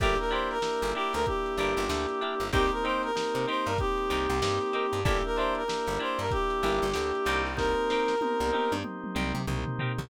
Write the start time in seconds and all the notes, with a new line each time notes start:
0.00 G1 A#3 D4 E4 G4 A#4, kick, crash
0.18 A#4, closed hi-hat
0.31 D4 E4 G4 A#4 C5, closed hi-hat
0.51 A#4, snare, closed hi-hat
0.62 A#3 D4 E4 G4, snare
0.82 G1, snare, closed hi-hat
0.95 D4 E4 G4 A#4, closed hi-hat
1.13 D2 A#4, snare, closed hi-hat
1.26 A#3 D4 E4 G4, kick, closed hi-hat
1.46 closed hi-hat
1.57 G1 D4 E4 G4 A#4, closed hi-hat
1.77 G1, closed hi-hat
1.89 D2 A#3 D4 E4 G4, snare
2.09 closed hi-hat
2.21 D4 E4 G4 A#4, closed hi-hat
2.40 G1, closed hi-hat
2.53 C2 A#3 C4 D#4 G4 A#4, kick, closed hi-hat
2.72 A#4, closed hi-hat
2.84 C4 D#4 G4 A#4 C5, closed hi-hat
3.03 A#4, closed hi-hat
3.15 A#3 C4 D#4 G4, snare
3.35 C3, closed hi-hat
3.47 C4 D#4 G4 A#4 C5, closed hi-hat
3.66 G2 A#4, closed hi-hat
3.78 A#3 C4 D#4 G4, kick, closed hi-hat
3.98 closed hi-hat
4.10 C2 C4 D#4 G4 A#4, closed hi-hat
4.29 C2, closed hi-hat
4.42 G2 A#3 C4 D#4 G4, snare
4.61 closed hi-hat
4.73 C4 D#4 G4 A#4, closed hi-hat
4.93 G2, closed hi-hat
5.05 G1 A#3 D4 E4 G4 A#4, kick, closed hi-hat
5.24 A#4, closed hi-hat
5.36 D4 E4 G4 C5, closed hi-hat
5.40 A#4
5.55 A#4, closed hi-hat
5.68 A#3 D4 E4 G4, snare
5.87 G1, closed hi-hat
5.99 D4 E4 G4 A#4 C5, closed hi-hat
6.19 G2 A#4, snare, closed hi-hat
6.31 A#3 D4 E4 G4, kick, closed hi-hat
6.50 closed hi-hat
6.63 G1 D4 E4 G4 A#4, snare, closed hi-hat
6.82 G1, closed hi-hat
6.94 D2 A#3 D4 E4 G4, snare
7.15 closed hi-hat
7.25 C2 C4 D#4 G4 A#4, closed hi-hat
7.46 snare, open hi-hat
7.57 A#3 C4 D#4 G4 A#4, kick, snare
7.90 C4 D#4 G4 A#4, snare
8.08 snare
8.21 A#3 C4 D#4 G4, high tom
8.40 C2, high tom
8.52 C4 D#4 G4 A#4, high tom
8.72 G2, high tom
8.84 A#3 C4 D#4 G4, mid tom
9.04 mid tom
9.15 C2 C4 D#4 G4 A#4, mid tom
9.34 C3, mid tom
9.47 C2 A#3 C4 D#4 G4, floor tom
9.66 floor tom
9.79 C4 D#4 G4 A#4, floor tom
9.98 C2, floor tom